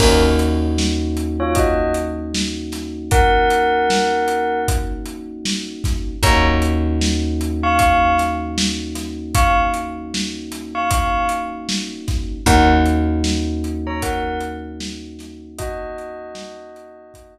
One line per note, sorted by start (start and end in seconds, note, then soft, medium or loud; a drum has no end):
0.00 5.75 D#2 loud
0.00 6.13 A#3 medium
0.00 0.22 C#4 medium
0.00 6.13 C#4 medium
0.00 6.13 D#4 medium
0.00 6.13 F#4 medium
0.00 0.22 A#4 medium
0.00 kick loud
0.00 crash loud
0.39 closed hi-hat medium
0.78 snare medium
1.17 closed hi-hat medium
1.40 1.55 F4 medium
1.40 1.55 C#5 medium
1.55 1.92 F#4 medium
1.55 1.92 D#5 medium
1.55 kick medium
1.55 closed hi-hat medium
1.94 closed hi-hat medium
2.34 snare loud
2.72 snare soft
2.72 closed hi-hat medium
3.11 4.59 A#4 medium
3.11 4.59 F#5 loud
3.11 kick loud
3.11 closed hi-hat medium
3.50 closed hi-hat medium
3.90 snare medium
4.28 closed hi-hat medium
4.68 kick medium
4.68 closed hi-hat medium
5.06 closed hi-hat medium
5.45 snare medium
5.84 kick medium
5.84 snare medium
5.84 closed hi-hat medium
6.23 11.98 D#2 loud
6.23 12.37 A#3 medium
6.23 12.37 C#4 medium
6.23 12.37 D#4 medium
6.23 12.37 F#4 medium
6.23 6.45 C#5 medium
6.23 6.45 A#5 loud
6.23 kick loud
6.23 closed hi-hat loud
6.62 closed hi-hat medium
7.01 snare medium
7.41 closed hi-hat medium
7.63 7.79 F5 medium
7.63 7.79 C#6 medium
7.79 8.15 F5 medium
7.79 8.15 C#6 medium
7.79 kick medium
7.79 closed hi-hat medium
8.18 snare soft
8.18 closed hi-hat medium
8.58 snare loud
8.95 snare medium
8.95 closed hi-hat medium
9.35 9.57 F5 medium
9.35 9.57 C#6 medium
9.35 kick medium
9.35 closed hi-hat loud
9.74 closed hi-hat medium
10.14 snare medium
10.52 snare soft
10.52 closed hi-hat medium
10.75 10.90 F5 medium
10.75 10.90 C#6 medium
10.91 11.27 F5 medium
10.91 11.27 C#6 medium
10.91 kick medium
10.91 closed hi-hat loud
11.29 closed hi-hat medium
11.69 snare medium
12.08 kick medium
12.08 snare medium
12.08 closed hi-hat medium
12.46 17.38 D#2 loud
12.46 17.38 A#3 medium
12.46 17.38 C#4 medium
12.46 17.38 D#4 medium
12.46 17.38 F#4 medium
12.46 12.69 A#4 medium
12.46 12.69 F#5 loud
12.46 kick medium
12.46 closed hi-hat medium
12.86 closed hi-hat medium
13.24 snare loud
13.64 closed hi-hat medium
13.87 14.02 C#5 medium
13.87 14.02 A#5 medium
14.02 14.40 A#4 medium
14.02 14.40 F#5 medium
14.02 kick medium
14.02 closed hi-hat loud
14.40 closed hi-hat medium
14.80 snare loud
15.19 snare medium
15.19 closed hi-hat medium
15.58 17.38 F#4 medium
15.58 17.38 D#5 loud
15.58 kick medium
15.58 closed hi-hat loud
15.98 closed hi-hat medium
16.35 snare loud
16.76 closed hi-hat medium
17.14 kick medium
17.14 closed hi-hat medium